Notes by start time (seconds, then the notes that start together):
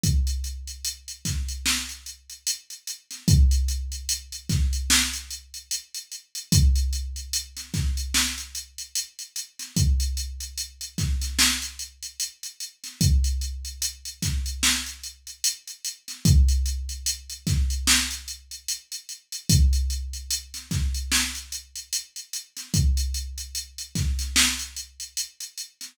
0.04 kick, closed hi-hat
0.27 closed hi-hat
0.44 closed hi-hat
0.67 closed hi-hat
0.85 closed hi-hat
1.08 closed hi-hat
1.25 kick, snare, closed hi-hat
1.48 closed hi-hat
1.66 snare
1.89 closed hi-hat
2.06 closed hi-hat
2.30 closed hi-hat
2.47 closed hi-hat
2.70 closed hi-hat
2.87 closed hi-hat
3.11 snare, closed hi-hat
3.28 kick, closed hi-hat
3.51 closed hi-hat
3.68 closed hi-hat
3.92 closed hi-hat
4.09 closed hi-hat
4.32 closed hi-hat
4.49 kick, snare, closed hi-hat
4.73 closed hi-hat
4.90 snare
5.13 closed hi-hat
5.31 closed hi-hat
5.54 closed hi-hat
5.71 closed hi-hat
5.94 closed hi-hat
6.12 closed hi-hat
6.35 closed hi-hat
6.52 kick, closed hi-hat
6.76 closed hi-hat
6.93 closed hi-hat
7.16 closed hi-hat
7.33 closed hi-hat
7.57 snare, closed hi-hat
7.74 kick, snare, closed hi-hat
7.97 closed hi-hat
8.14 snare
8.38 closed hi-hat
8.55 closed hi-hat
8.78 closed hi-hat
8.95 closed hi-hat
9.19 closed hi-hat
9.36 closed hi-hat
9.59 snare, closed hi-hat
9.77 kick, closed hi-hat
10.00 closed hi-hat
10.17 closed hi-hat
10.40 closed hi-hat
10.58 closed hi-hat
10.81 closed hi-hat
10.98 kick, snare, closed hi-hat
11.21 snare, closed hi-hat
11.39 snare
11.62 closed hi-hat
11.79 closed hi-hat
12.03 closed hi-hat
12.20 closed hi-hat
12.43 closed hi-hat
12.60 closed hi-hat
12.84 snare, closed hi-hat
13.01 kick, closed hi-hat
13.24 closed hi-hat
13.41 closed hi-hat
13.65 closed hi-hat
13.82 closed hi-hat
14.05 closed hi-hat
14.22 kick, snare, closed hi-hat
14.46 closed hi-hat
14.63 snare
14.86 closed hi-hat
15.04 closed hi-hat
15.27 closed hi-hat
15.44 closed hi-hat
15.68 closed hi-hat
15.85 closed hi-hat
16.08 snare, closed hi-hat
16.25 kick, closed hi-hat
16.48 closed hi-hat
16.66 closed hi-hat
16.89 closed hi-hat
17.06 closed hi-hat
17.30 closed hi-hat
17.47 kick, snare, closed hi-hat
17.70 closed hi-hat
17.87 snare
18.11 closed hi-hat
18.28 closed hi-hat
18.51 closed hi-hat
18.68 closed hi-hat
18.92 closed hi-hat
19.09 closed hi-hat
19.32 closed hi-hat
19.49 kick, closed hi-hat
19.73 closed hi-hat
19.90 closed hi-hat
20.13 closed hi-hat
20.31 closed hi-hat
20.54 snare, closed hi-hat
20.71 kick, snare, closed hi-hat
20.94 closed hi-hat
21.12 snare
21.35 closed hi-hat
21.52 closed hi-hat
21.76 closed hi-hat
21.93 closed hi-hat
22.16 closed hi-hat
22.33 closed hi-hat
22.57 snare, closed hi-hat
22.74 kick, closed hi-hat
22.97 closed hi-hat
23.14 closed hi-hat
23.38 closed hi-hat
23.55 closed hi-hat
23.78 closed hi-hat
23.95 kick, snare, closed hi-hat
24.19 snare, closed hi-hat
24.36 snare
24.59 closed hi-hat
24.77 closed hi-hat
25.00 closed hi-hat
25.17 closed hi-hat
25.40 closed hi-hat
25.58 closed hi-hat
25.81 snare, closed hi-hat